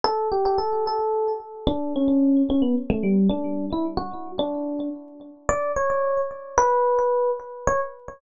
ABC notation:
X:1
M:3/4
L:1/16
Q:1/4=110
K:D
V:1 name="Electric Piano 1"
A2 G G A2 A4 z2 | D2 C4 C B, z A, G,2 | D3 E z F3 D4 | z4 d2 c4 z2 |
B6 z2 c z3 |]